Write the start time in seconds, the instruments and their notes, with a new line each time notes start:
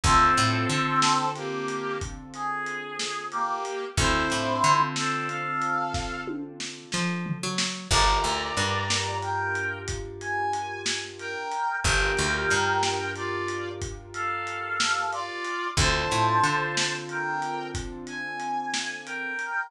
0.03 electric bass (finger) D2, brass section C4 A4, acoustic grand piano C4 D4 F4 A4, kick, closed hi-hat
0.37 electric bass (finger) A2, closed hi-hat
0.69 electric bass (finger) D3, closed hi-hat
1.02 snare
1.35 brass section A#3 G4, closed hi-hat
1.68 closed hi-hat
2.01 kick, closed hi-hat
2.34 brass section G#4, closed hi-hat
2.66 closed hi-hat
2.99 snare
3.32 brass section A#3 G4, closed hi-hat
3.65 closed hi-hat
3.97 electric bass (finger) D2, acoustic grand piano C4 D4 F4 A4, brass section E4 C5, kick, closed hi-hat
4.30 electric bass (finger) A2, closed hi-hat
4.64 electric bass (finger) D3, closed hi-hat
4.96 brass section C4 A4, snare
5.28 brass section A4 F5, closed hi-hat
5.61 closed hi-hat
5.94 kick, snare
6.27 high tom
6.60 snare
6.92 electric bass (finger) F3, snare
7.26 floor tom
7.43 electric bass (finger) F#3
7.58 snare
7.90 electric bass (finger) G1, acoustic grand piano D4 F4 G4 A#4, brass section D5 A#5, kick, crash
8.24 electric bass (finger) D2, closed hi-hat
8.57 electric bass (finger) G2, closed hi-hat
8.90 snare
9.22 brass section A#4 G5, closed hi-hat
9.55 closed hi-hat
9.88 kick, closed hi-hat
10.20 brass section G#5, closed hi-hat
10.53 closed hi-hat
10.86 snare
11.19 brass section A#4 G5, closed hi-hat
11.52 closed hi-hat
11.84 electric bass (finger) G1, acoustic grand piano D4 F4 G4 A#4, brass section A#4 G5, kick, closed hi-hat
12.17 electric bass (finger) D2, closed hi-hat
12.50 electric bass (finger) G2, closed hi-hat
12.83 snare
13.15 brass section F4 D5, closed hi-hat
13.48 closed hi-hat
13.82 kick, closed hi-hat
14.14 brass section A4 F5, closed hi-hat
14.47 closed hi-hat
14.80 snare
15.12 brass section F4 D5, closed hi-hat
15.45 closed hi-hat
15.77 electric bass (finger) D2, acoustic grand piano C4 D4 F4 A4, brass section C5 A5, kick, closed hi-hat
16.11 electric bass (finger) A2, closed hi-hat
16.43 electric bass (finger) D3, closed hi-hat
16.77 snare
17.09 brass section A#4 G5, closed hi-hat
17.42 closed hi-hat
17.74 kick, closed hi-hat
18.07 brass section G#5, closed hi-hat
18.40 closed hi-hat
18.74 snare
19.06 brass section A#4 G5, closed hi-hat
19.39 closed hi-hat